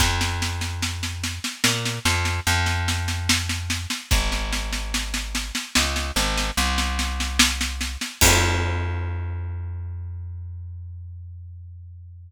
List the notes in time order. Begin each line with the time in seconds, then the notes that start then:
0.00 F2, kick, snare
0.21 snare
0.42 snare
0.61 snare
0.82 snare
1.03 snare
1.23 snare
1.44 snare
1.64 A#2, snare
1.85 snare
2.05 F2, snare
2.25 snare
2.47 F2, snare
2.66 snare
2.88 snare
3.08 snare
3.29 snare
3.49 snare
3.70 snare
3.90 snare
4.11 G#1, kick, snare
4.32 snare
4.53 snare
4.73 snare
4.94 snare
5.14 snare
5.35 snare
5.55 snare
5.75 C#2, snare
5.96 snare
6.16 G#1, snare
6.38 snare
6.57 C2, snare
6.78 snare
6.99 snare
7.20 snare
7.39 snare
7.61 snare
7.81 snare
8.01 snare
8.21 F2, kick, crash